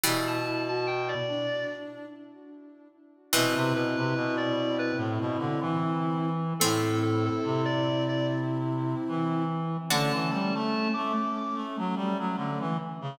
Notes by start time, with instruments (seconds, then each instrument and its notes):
0.04 clarinet B2 B5, harpsichord E3 G3, ocarina E4
0.27 clarinet A5
0.46 ocarina E4
0.68 ocarina F#4, clarinet A5
0.87 clarinet G5
1.08 clarinet D5
1.28 ocarina D4
3.33 clarinet B2 B4, harpsichord C3 E3, ocarina C4 E4
3.56 clarinet C3
3.74 clarinet B2 B4
3.97 clarinet C3 B4
4.15 clarinet B2
4.37 clarinet D5
4.79 clarinet B4
4.97 clarinet A2
5.20 clarinet B2
5.38 clarinet D3
5.61 clarinet E3
6.60 clarinet A2 A4, harpsichord A3 C4, ocarina C4 E4
7.02 clarinet A4
7.26 clarinet A4
7.44 clarinet C3
7.65 clarinet D5
8.09 clarinet D5
9.08 clarinet E3
9.89 clarinet D3 A5, ocarina A3 C#4, harpsichord D4 F#4
10.13 clarinet E3
10.31 clarinet G3 A5
10.54 clarinet A3 A5
10.94 clarinet A3 D6
11.37 clarinet D6
11.55 clarinet A3
11.78 clarinet F#3
11.96 clarinet G3
12.19 clarinet F#3
12.37 clarinet D3
12.60 clarinet E3
13.01 clarinet C#3